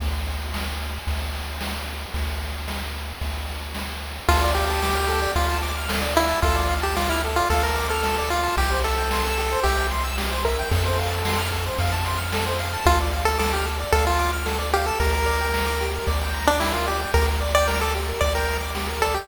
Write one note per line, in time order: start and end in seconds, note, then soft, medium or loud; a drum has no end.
0.00 0.99 D2 medium
0.00 kick medium
0.00 crash medium
0.26 ride medium
0.54 snare medium
0.80 ride medium
1.07 2.06 D2 medium
1.07 kick medium
1.07 ride medium
1.34 snare soft
1.34 ride medium
1.61 snare medium
1.87 ride medium
2.14 3.13 D2 medium
2.14 kick medium
2.14 ride medium
2.41 ride soft
2.68 snare medium
2.95 ride soft
3.21 4.20 D2 medium
3.21 kick medium
3.21 ride medium
3.48 snare soft
3.48 ride medium
3.75 snare medium
4.02 ride medium
4.28 5.27 D2 loud
4.28 4.51 F4 medium
4.28 4.40 A4 loud
4.28 kick medium
4.28 ride loud
4.41 4.53 D5 medium
4.55 5.32 G4 medium
4.55 4.68 F5 medium
4.55 ride medium
4.69 4.81 A5 medium
4.82 4.94 D6 medium
4.82 snare medium
4.95 5.07 F6 medium
5.08 5.20 A4 medium
5.08 ride medium
5.22 5.34 D5 medium
5.35 6.34 D2 medium
5.35 5.58 F4 medium
5.35 5.48 F5 medium
5.35 kick medium
5.35 ride medium
5.50 5.62 A5 medium
5.63 5.75 D6 medium
5.63 snare soft
5.63 ride medium
5.77 5.89 F6 medium
5.89 6.01 A4 medium
5.89 snare loud
6.02 6.14 D5 medium
6.15 6.40 E4 medium
6.15 6.27 F5 medium
6.15 ride medium
6.29 6.41 A5 medium
6.42 7.41 D2 loud
6.42 6.75 F4 medium
6.42 6.56 A4 loud
6.42 kick loud
6.42 ride medium
6.56 6.68 D5 medium
6.69 6.81 F5 medium
6.69 ride medium
6.82 6.96 G4 medium
6.82 6.94 A5 medium
6.96 7.09 F4 medium
6.96 7.08 D6 medium
6.96 snare medium
7.09 7.22 E4 medium
7.09 7.22 F6 medium
7.24 7.36 A4 medium
7.24 ride medium
7.36 7.49 F4 medium
7.36 7.48 D5 medium
7.50 8.49 D2 medium
7.50 7.63 A4 medium
7.50 7.62 F5 loud
7.50 kick medium
7.50 ride medium
7.63 7.87 A#4 medium
7.63 7.75 A5 medium
7.75 7.87 D6 medium
7.75 snare soft
7.75 ride medium
7.89 8.29 A4 medium
7.89 8.01 F6 medium
8.03 8.16 A4 medium
8.03 snare medium
8.18 8.30 D5 medium
8.30 8.56 F4 medium
8.30 8.43 F5 medium
8.30 ride medium
8.43 8.55 A5 medium
8.57 9.56 C2 medium
8.57 8.70 G4 medium
8.57 8.79 G4 medium
8.57 kick medium
8.57 ride medium
8.71 8.83 C5 medium
8.84 9.60 A4 medium
8.84 8.96 E5 medium
8.84 ride medium
8.98 9.10 G5 medium
9.11 9.24 C6 medium
9.11 snare loud
9.24 9.36 E6 medium
9.37 9.50 G4 medium
9.37 ride medium
9.52 9.64 C5 medium
9.63 10.63 C2 medium
9.63 9.87 G4 medium
9.63 9.77 E5 medium
9.63 kick medium
9.63 ride medium
9.77 9.89 G5 medium
9.91 10.03 C6 medium
9.91 snare soft
9.91 ride medium
10.04 10.16 E6 medium
10.18 10.30 G4 medium
10.18 snare loud
10.31 10.43 C5 medium
10.44 10.69 A#4 medium
10.44 10.57 E5 medium
10.44 kick medium
10.44 ride medium
10.59 10.71 G5 medium
10.71 11.70 F2 loud
10.71 10.83 A4 medium
10.71 11.41 A4 medium
10.71 kick medium
10.71 ride loud
10.85 10.97 C5 medium
10.99 11.11 F5 medium
10.99 ride medium
11.10 11.22 A5 medium
11.25 11.38 C6 medium
11.25 snare loud
11.38 11.50 F6 medium
11.51 11.64 A4 medium
11.51 kick medium
11.51 ride medium
11.66 11.78 C5 medium
11.78 12.77 F2 medium
11.78 11.91 F5 medium
11.78 kick medium
11.78 ride medium
11.92 12.04 A5 medium
12.05 12.18 C6 medium
12.05 snare soft
12.05 ride medium
12.17 12.29 F6 medium
12.32 12.45 A4 medium
12.32 snare loud
12.46 12.58 C5 medium
12.59 12.72 F5 medium
12.59 ride medium
12.73 12.85 A5 medium
12.85 13.84 D2 loud
12.85 12.99 F4 medium
12.85 12.97 A4 medium
12.85 kick medium
12.85 ride medium
13.00 13.12 D5 medium
13.12 13.25 F5 medium
13.12 ride medium
13.25 13.38 A4 medium
13.25 13.39 A5 medium
13.38 13.52 A4 medium
13.38 13.50 D6 medium
13.38 snare medium
13.53 13.66 G4 medium
13.53 13.66 F6 medium
13.65 13.77 A4 medium
13.65 ride medium
13.79 13.92 D5 medium
13.92 14.91 D2 loud
13.92 14.05 A4 medium
13.92 14.05 F5 medium
13.92 kick medium
13.92 ride medium
14.05 14.31 F4 medium
14.05 14.17 A5 medium
14.19 14.31 D6 medium
14.19 snare medium
14.19 ride medium
14.33 14.45 F6 medium
14.46 14.58 A4 medium
14.46 snare medium
14.58 14.71 D5 medium
14.73 14.86 G4 medium
14.73 14.85 F5 medium
14.73 ride medium
14.86 14.99 A4 medium
14.86 14.99 A5 medium
15.00 15.99 D2 loud
15.00 15.12 G4 medium
15.00 15.86 A#4 medium
15.00 kick medium
15.00 ride medium
15.13 15.25 A#4 medium
15.26 15.38 D5 medium
15.26 ride medium
15.41 15.53 G5 medium
15.54 15.66 A#5 medium
15.54 snare medium
15.66 15.78 D6 medium
15.80 15.93 G4 medium
15.80 ride medium
15.94 16.06 A#4 medium
16.07 17.06 D2 medium
16.07 16.19 D5 medium
16.07 kick medium
16.07 ride medium
16.21 16.33 G5 medium
16.34 16.46 A#5 medium
16.34 snare soft
16.34 ride medium
16.47 16.60 D4 medium
16.47 16.59 D6 medium
16.60 16.73 E4 medium
16.60 16.73 G4 medium
16.60 snare medium
16.73 16.86 F4 medium
16.73 16.85 A#4 medium
16.86 17.00 G4 medium
16.86 16.98 D5 medium
16.86 ride medium
17.00 17.12 G5 medium
17.14 18.13 D2 loud
17.14 17.26 G4 loud
17.14 17.27 A#4 medium
17.14 kick medium
17.14 ride medium
17.28 17.40 A#4 medium
17.41 17.53 D5 medium
17.41 ride medium
17.55 17.67 D5 medium
17.55 17.68 G5 medium
17.68 17.80 A#4 medium
17.68 17.80 A#5 medium
17.68 snare medium
17.80 17.94 A4 medium
17.80 17.92 D6 medium
17.95 18.07 G4 medium
17.95 ride medium
18.08 18.20 A#4 medium
18.21 19.20 D2 medium
18.21 18.33 D5 medium
18.21 kick medium
18.21 ride medium
18.35 18.57 A#4 medium
18.35 18.47 G5 medium
18.48 18.61 A#5 medium
18.48 snare medium
18.48 ride medium
18.61 18.73 D6 medium
18.75 18.87 G4 medium
18.75 snare medium
18.89 19.01 A#4 medium
19.02 19.15 A4 medium
19.02 19.14 D5 medium
19.02 kick medium
19.02 ride medium
19.14 19.27 G4 medium
19.14 19.28 G5 medium